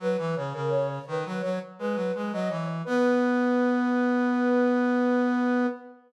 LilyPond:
<<
  \new Staff \with { instrumentName = "Flute" } { \time 4/4 \key b \major \tempo 4 = 84 b'8 cis''16 ais'16 cis''16 cis''16 b'8 cis''16 r16 b'8 b'16 dis''16 cis''16 r16 | b'1 | }
  \new Staff \with { instrumentName = "Brass Section" } { \time 4/4 \key b \major fis16 e16 cis16 cis8. dis16 fis16 fis16 r16 gis16 fis16 gis16 fis16 e8 | b1 | }
>>